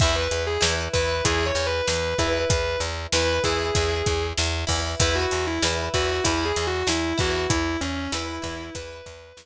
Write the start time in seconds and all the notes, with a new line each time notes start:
0.00 E2 E4 B4 E5, kick, crash
0.16 B4
0.31 E2, closed hi-hat
0.47 G#4
0.61 E2 E4 B4, snare
0.93 E2 E4 B4, kick, closed hi-hat
1.24 E2 E4 G#4 B4, kick, closed hi-hat
1.46 C#5
1.55 E2, closed hi-hat
1.67 B4
1.88 E2 B4, snare
2.18 E2 E4 B4, kick, closed hi-hat
2.49 E2 B4, kick, closed hi-hat
2.80 E2, closed hi-hat
3.12 E2 E4 B4, snare
3.44 E2 E4 G#4 B4, kick, closed hi-hat
3.75 E2 E4 B4, kick, closed hi-hat
4.06 E2, kick, closed hi-hat
4.38 E2, snare
4.67 E2 E4 B4, kick, open hi-hat
5.00 E2 E4 B4, kick, closed hi-hat
5.15 F#4
5.31 E2, closed hi-hat
5.47 E4
5.62 E2 E4 B4, snare
5.94 E2 E4 F#4 B4, kick, closed hi-hat
6.24 E2 E4 B4, kick, closed hi-hat
6.45 G#4
6.56 E2, closed hi-hat
6.67 F#4
6.87 E2 E4, snare
7.18 E2 E4 F#4 B4, kick, closed hi-hat
7.50 E2 E4, kick, closed hi-hat
7.81 E2 C#4, closed hi-hat
7.96 C#4
8.12 E2 E4 B4, snare
8.42 E2 E4 B4, kick, closed hi-hat
8.75 E2 E4 B4, kick, closed hi-hat
9.06 E2, kick, closed hi-hat
9.37 E2, snare